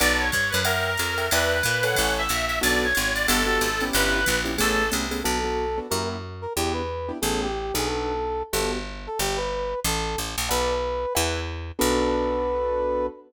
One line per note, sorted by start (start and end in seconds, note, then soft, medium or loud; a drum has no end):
0.00 0.31 B1 loud
0.00 0.25 B4 medium
0.00 0.25 D5 loud
0.00 0.19 D5 medium
0.00 0.25 F#5 loud
0.00 0.25 A5 loud
0.00 ride medium
0.19 0.51 C#5 medium
0.32 0.52 G2 medium
0.32 kick medium
0.32 hi-hat pedal medium
0.32 ride medium
0.50 0.61 B4 medium
0.50 ride medium
0.54 0.97 F#2 loud
0.64 1.27 A#4 medium
0.64 0.90 A#4 medium
0.64 0.90 E5 medium
0.64 0.90 F#5 medium
0.64 0.90 G5 medium
0.64 ride medium
0.97 1.29 F2 medium
0.97 hi-hat pedal medium
0.97 ride medium
1.18 1.27 A#4 medium
1.18 1.27 E5 medium
1.18 1.27 F#5 medium
1.18 1.27 G5 medium
1.18 ride medium
1.31 1.62 E2 loud
1.31 1.57 B4 medium
1.31 1.84 B4 medium
1.31 1.57 D5 medium
1.31 1.57 E5 medium
1.31 1.57 G5 medium
1.31 ride medium
1.63 1.96 A#2 loud
1.63 kick medium
1.63 hi-hat pedal medium
1.63 ride medium
1.83 2.22 A4 medium
1.83 2.22 B4 medium
1.83 2.22 C#5 loud
1.83 2.12 F#5 medium
1.83 2.22 G#5 medium
1.83 ride medium
1.95 2.28 A1 medium
1.95 kick medium
1.95 ride medium
2.18 2.45 E5 medium
2.29 2.60 A#1 medium
2.29 hi-hat pedal medium
2.29 ride medium
2.47 2.58 E5 medium
2.47 ride medium
2.61 2.93 B1 loud
2.61 2.86 B3 loud
2.61 2.86 D4 medium
2.61 2.86 F#4 loud
2.61 2.86 A4 medium
2.61 2.82 D5 loud
2.61 ride medium
2.83 3.12 C#5 medium
2.95 3.27 G#1 medium
2.95 hi-hat pedal medium
2.95 ride medium
3.15 3.26 D5 medium
3.15 ride medium
3.27 3.59 G1 loud
3.27 3.42 B3 loud
3.27 3.42 F#4 loud
3.27 3.42 G4 medium
3.27 3.83 A4 medium
3.27 3.42 A4 medium
3.27 ride loud
3.47 3.67 B3 medium
3.47 3.67 F#4 medium
3.47 3.67 G4 medium
3.47 3.67 A4 medium
3.61 3.91 G#1 medium
3.61 hi-hat pedal medium
3.61 ride medium
3.80 4.19 B3 medium
3.80 4.19 C#4 medium
3.80 4.19 E4 loud
3.80 4.19 G4 loud
3.80 ride medium
3.93 4.25 G1 loud
3.93 4.39 B4 loud
3.93 ride medium
4.26 4.58 A#1 loud
4.26 kick medium
4.26 hi-hat pedal medium
4.26 ride medium
4.45 4.54 B3 medium
4.45 4.54 C#4 medium
4.45 4.54 E4 medium
4.45 4.54 G4 medium
4.45 ride medium
4.58 4.91 A1 loud
4.58 4.83 A3 medium
4.58 4.83 B3 medium
4.58 4.83 C#4 loud
4.58 4.83 G#4 medium
4.58 4.89 A4 medium
4.58 kick medium
4.58 ride medium
4.92 5.23 C2 medium
4.92 5.05 A3 medium
4.92 5.05 B3 medium
4.92 5.05 C#4 medium
4.92 5.05 G#4 medium
4.92 hi-hat pedal medium
4.92 ride medium
5.11 5.20 A3 medium
5.11 5.20 B3 medium
5.11 5.20 C#4 medium
5.11 5.20 G#4 medium
5.11 ride medium
5.23 5.80 B1 medium
5.23 5.38 B3 medium
5.23 5.38 D4 medium
5.23 5.38 F#4 medium
5.23 5.79 A4 medium
5.23 5.38 A4 medium
5.44 5.65 B3 medium
5.44 5.65 D4 medium
5.44 5.65 F#4 medium
5.44 5.65 A4 medium
5.78 5.87 B3 medium
5.78 5.87 D4 medium
5.78 5.87 F#4 medium
5.78 5.87 A4 medium
5.90 6.47 F#2 medium
5.90 6.16 A#3 medium
5.90 6.16 E4 medium
5.90 6.16 F#4 medium
5.90 6.16 G4 medium
5.90 6.08 A#4 medium
6.42 6.53 A#4 medium
6.56 7.12 E2 medium
6.56 6.82 B3 medium
6.56 6.82 D4 medium
6.56 6.82 E4 medium
6.56 6.73 G4 medium
6.56 6.82 G4 medium
6.73 7.12 B4 medium
7.09 7.18 B3 medium
7.09 7.18 D4 medium
7.09 7.18 E4 medium
7.09 7.18 G4 medium
7.22 7.72 A1 medium
7.22 7.47 A3 medium
7.22 7.47 B3 medium
7.22 7.47 C#4 medium
7.22 7.47 G#4 medium
7.22 7.41 A4 medium
7.42 7.74 G4 medium
7.74 8.43 B1 medium
7.74 8.12 B3 medium
7.74 8.12 D4 medium
7.74 8.12 F#4 medium
7.74 7.89 G#4 medium
7.74 8.12 A4 medium
7.86 8.43 A4 medium
8.53 9.08 G1 medium
8.53 8.78 B3 medium
8.53 8.78 F#4 medium
8.53 8.78 G4 medium
8.53 8.78 A4 medium
8.53 8.72 A4 medium
9.07 9.19 A4 medium
9.19 9.74 G1 medium
9.19 9.38 G4 medium
9.37 9.80 B4 medium
9.84 10.16 A1 loud
9.84 10.18 A4 medium
10.18 10.36 A1 medium
10.38 10.49 A#1 medium
10.49 11.06 B1 loud
10.49 10.74 B4 medium
10.49 11.13 B4 medium
10.49 10.74 D5 medium
10.49 10.74 F#5 medium
10.49 10.74 A5 medium
11.15 11.72 E2 loud
11.15 11.40 B4 medium
11.15 11.40 E5 medium
11.15 11.40 F#5 medium
11.15 11.40 G#5 medium
11.79 13.09 B1 loud
11.79 13.07 B3 medium
11.79 13.07 D4 loud
11.79 13.07 F#4 medium
11.79 13.07 A4 loud
11.79 13.06 B4 loud